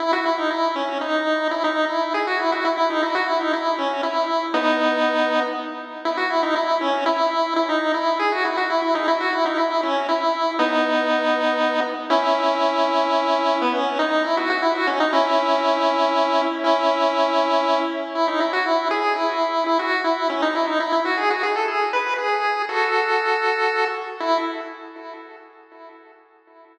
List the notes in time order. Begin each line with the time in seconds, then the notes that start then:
0.00 E4
0.13 F#4
0.26 E4
0.38 D#4
0.51 E4
0.76 C#4
1.01 D#4
1.51 E4
1.64 D#4
1.89 E4
2.14 G#4
2.27 F#4
2.39 E4
2.52 F#4
2.65 E4
2.77 E4
2.90 D#4
3.03 E4
3.15 F#4
3.28 E4
3.40 D#4
3.53 E4
3.78 C#4
4.03 E4
4.54 B3 D#4
6.05 E4
6.17 F#4
6.30 E4
6.43 D#4
6.56 E4
6.81 C#4
7.06 E4
7.56 E4
7.69 D#4
7.94 E4
8.19 G#4
8.32 F#4
8.45 E4
8.57 F#4
8.70 E4
8.82 E4
8.95 D#4
9.08 E4
9.20 F#4
9.33 E4
9.46 D#4
9.58 E4
9.83 C#4
10.09 E4
10.59 B3 D#4
12.10 C#4 E4
13.61 B3
13.74 C#4
13.99 D#4
14.24 E4
14.37 F#4
14.50 F#4
14.62 E4
14.75 F#4
14.87 C#4
15.00 D#4
15.13 C#4 E4
16.64 C#4 E4
18.15 E4
18.28 D#4
18.40 E4
18.53 F#4
18.66 E4
18.91 G#4
19.16 E4
19.66 E4
19.79 F#4
20.04 E4
20.30 C#4
20.42 D#4
20.55 E4
20.67 D#4
20.80 E4
20.92 E4
21.05 F#4
21.18 G#4
21.30 F#4
21.43 G#4
21.56 A4
21.68 G#4
21.93 B4
22.18 G#4
22.69 F#4 A4
24.20 E4